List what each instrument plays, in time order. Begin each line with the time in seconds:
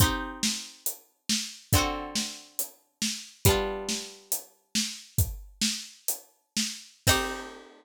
0.00 pizzicato strings C4 D#4 G4, kick, closed hi-hat
0.43 snare
0.86 closed hi-hat
1.29 snare
1.73 pizzicato strings D3 C4 F#4, kick, closed hi-hat
1.78 pizzicato strings A4
2.15 snare
2.59 closed hi-hat
3.02 snare
3.45 pizzicato strings G3 B3 D4, kick, closed hi-hat
3.50 pizzicato strings F4
3.89 snare
4.32 closed hi-hat
4.75 snare
5.18 kick, closed hi-hat
5.62 snare
6.08 closed hi-hat
6.57 snare
7.07 pizzicato strings C4 D#4 G4, kick, crash